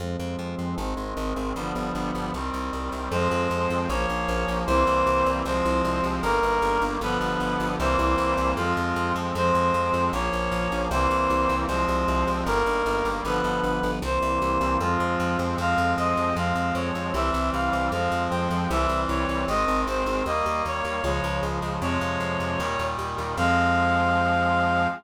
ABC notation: X:1
M:2/2
L:1/8
Q:1/2=77
K:Fm
V:1 name="Clarinet"
z8 | z8 | c4 d4 | c4 c4 |
B4 =B4 | c4 F3 z | c4 d4 | c4 c4 |
B4 =B4 | c4 F3 z | f2 e2 f2 d2 | =e2 f2 f2 g2 |
=e2 d2 _e2 c2 | e2 d2 d2 z2 | d6 z2 | f8 |]
V:2 name="Brass Section"
[F,A,C]4 [E,A,C]4 | [=D,F,G,=B,]4 [E,G,C]4 | [F,A,C]4 [F,B,D]4 | [=E,G,B,C]4 [F,A,C]4 |
[E,G,B,]4 [=D,F,G,=B,]4 | [=E,G,B,C]4 [F,A,C]4 | [F,A,C]4 [F,B,D]4 | [=E,G,B,C]4 [F,A,C]4 |
[E,G,B,]4 [=D,F,G,=B,]4 | [=E,G,B,C]4 [F,A,C]4 | [F,A,C]4 [F,A,C]4 | [=E,G,C]4 [F,A,C]4 |
[=E,G,C]4 [_E,A,C]4 | [E,G,B,]4 [D,F,A,]4 | [C,F,A,]4 [B,,E,G,]4 | [F,A,C]8 |]
V:3 name="Electric Bass (finger)" clef=bass
F,, F,, F,, F,, A,,, A,,, A,,, A,,, | G,,, G,,, G,,, G,,, C,, C,, C,, C,, | F,, F,, F,, F,, B,,, B,,, B,,, B,,, | C,, C,, C,, C,, C,, C,, C,, C,, |
G,,, G,,, G,,, G,,, G,,, G,,, G,,, G,,, | C,, C,, C,, C,, F,, F,, F,, F,, | F,, F,, F,, F,, B,,, B,,, B,,, B,,, | C,, C,, C,, C,, C,, C,, C,, C,, |
G,,, G,,, G,,, G,,, G,,, G,,, G,,, G,,, | C,, C,, C,, C,, F,, F,, F,, F,, | F,, F,, F,, F,, F,, F,, F,, F,, | C,, C,, C,, C,, F,, F,, F,, F,, |
C,, C,, C,, C,, A,,, A,,, A,,, A,,, | E,, E,, E,, E,, D,, D,, D,, D,, | F,, F,, F,, F,, E,, E,, E,, E,, | F,,8 |]